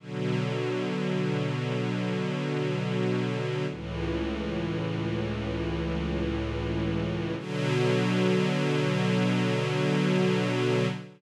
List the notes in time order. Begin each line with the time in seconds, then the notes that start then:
0.00 B2 D3 F#3
3.70 C#2 A2 E3
7.38 B2 D3 F#3